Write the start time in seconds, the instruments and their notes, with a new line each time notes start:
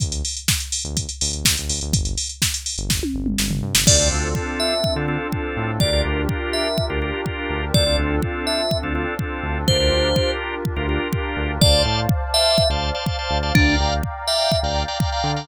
0.00 synth bass 1 D2, kick, closed hi-hat
0.12 closed hi-hat
0.25 open hi-hat
0.37 closed hi-hat
0.48 kick, snare
0.60 closed hi-hat
0.72 open hi-hat
0.85 synth bass 1 D2, closed hi-hat
0.97 kick, closed hi-hat
1.09 closed hi-hat
1.21 synth bass 1 D2, open hi-hat
1.33 closed hi-hat
1.45 synth bass 1 D2, kick, snare
1.57 synth bass 1 D2, closed hi-hat
1.69 synth bass 1 D2, open hi-hat
1.81 synth bass 1 D2, closed hi-hat
1.93 synth bass 1 G1, kick, closed hi-hat
2.05 closed hi-hat
2.18 open hi-hat
2.29 closed hi-hat
2.42 kick, snare
2.54 closed hi-hat
2.66 open hi-hat
2.78 synth bass 1 G1, closed hi-hat
2.90 kick, snare
3.03 high tom
3.14 synth bass 1 G1
3.26 mid tom
3.38 synth bass 1 G1, snare
3.51 synth bass 1 G1, floor tom
3.63 synth bass 1 G2
3.75 synth bass 1 G1, snare
3.86 synth bass 1 D2, pad 2 (warm) C4 D4 F4 A4, drawbar organ C4 D4 F4 A4, electric piano 2 D5, kick, crash
3.99 drawbar organ C4 D4 F4 A4
4.12 synth bass 1 D2
4.35 drawbar organ C4 D4 F4 A4, kick
4.60 electric piano 2 E5
4.84 kick
4.96 synth bass 1 D3, drawbar organ C4 D4 F4 A4
5.08 drawbar organ C4 D4 F4 A4
5.32 drawbar organ C4 D4 F4 A4, kick
5.57 synth bass 1 A2
5.80 synth bass 1 D2, drawbar organ D4 F4 G4 A#4, pad 2 (warm) D4 F4 G4 A#4, electric piano 2 D5, kick
5.93 drawbar organ D4 F4 G4 A#4
6.05 synth bass 1 D2
6.29 drawbar organ D4 F4 G4 A#4, kick
6.53 electric piano 2 E5
6.78 kick
6.90 synth bass 1 D2, drawbar organ D4 F4 G4 A#4
7.02 drawbar organ D4 F4 G4 A#4
7.26 drawbar organ D4 F4 G4 A#4, kick
7.50 synth bass 1 D2
7.74 synth bass 1 D2, drawbar organ C4 D4 F4 A4, pad 2 (warm) C4 D4 F4 A4, electric piano 2 D5, kick
7.86 drawbar organ C4 D4 F4 A4
7.98 synth bass 1 D2
8.22 drawbar organ C4 D4 F4 A4, kick
8.47 electric piano 2 E5
8.71 kick
8.83 synth bass 1 D2, drawbar organ C4 D4 F4 A4
8.95 drawbar organ C4 D4 F4 A4
9.19 drawbar organ C4 D4 F4 A4, kick
9.43 synth bass 1 D2
9.68 synth bass 1 D2, pad 2 (warm) D4 F4 G4 A#4, drawbar organ D4 F4 G4 A#4, electric piano 2 C5, kick
9.80 drawbar organ D4 F4 G4 A#4
9.92 synth bass 1 D2
10.16 drawbar organ D4 F4 G4 A#4, kick
10.65 kick
10.76 synth bass 1 D2, drawbar organ D4 F4 G4 A#4
10.89 drawbar organ D4 F4 G4 A#4
11.13 drawbar organ D4 F4 G4 A#4, kick
11.36 synth bass 1 D2
11.61 synth bass 1 D2, drawbar organ C5 D5 F5 A5, pad 2 (warm) C5 D5 F5 A5, electric piano 2 D5, kick
11.85 synth bass 1 A2
12.09 kick
12.34 drawbar organ C5 D5 F5 A5, electric piano 2 E5
12.58 kick
12.69 synth bass 1 D2, drawbar organ C5 D5 F5 A5
12.94 drawbar organ C5 D5 F5 A5
13.06 drawbar organ C5 D5 F5 A5, kick
13.19 drawbar organ C5 D5 F5 A5
13.30 synth bass 1 D2
13.43 drawbar organ C5 D5 F5 A5
13.55 synth bass 1 D2, electric piano 2 D4, drawbar organ D5 F5 G5 A#5, pad 2 (warm) D5 F5 G5 A#5, kick
13.80 synth bass 1 D2
14.03 kick
14.27 drawbar organ D5 F5 G5 A#5, electric piano 2 E5
14.52 kick
14.63 synth bass 1 D2, drawbar organ D5 F5 G5 A#5
14.88 drawbar organ D5 F5 G5 A#5
15.00 drawbar organ D5 F5 G5 A#5, kick
15.12 drawbar organ D5 F5 G5 A#5
15.24 synth bass 1 D3
15.36 drawbar organ D5 F5 G5 A#5